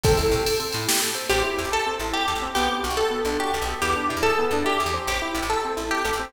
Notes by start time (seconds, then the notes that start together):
0.03 A1 C4 A4, kick, ride
0.17 A1 E4, ride
0.31 A1 G4, ride
0.45 A4, ride
0.60 C4, ride
0.72 A2 E4, ride
0.88 G4, snare
1.02 A4, ride
1.14 C4, ride
1.29 A1 C4 G4
1.44 E4
1.57 E2 G4
1.64 A1
1.72 A4
1.86 C4
1.99 A1 E4
2.13 G4
2.28 E2 A4
2.35 A1
2.42 C4
2.55 B1 B3 G4
2.71 D4
2.83 B1 F#4
2.90 B1
2.97 A4
3.11 B3
3.25 B1 D4
3.39 F#4 G4
3.54 B1 A4
3.62 B1
3.68 B3
3.82 E2 B3 G4
3.96 D4
4.09 B2 E4
4.17 E2
4.23 G#4 A4
4.39 B3
4.51 E2 D4
4.64 E4 G4
4.80 E2 G#4
4.86 E2
4.94 C4
5.07 A1 G4
5.22 E4
5.34 A1 G4
5.42 A1
5.50 A4
5.65 C4
5.77 A1 E4
5.91 G4
6.05 A1 A4
6.13 A1
6.19 C4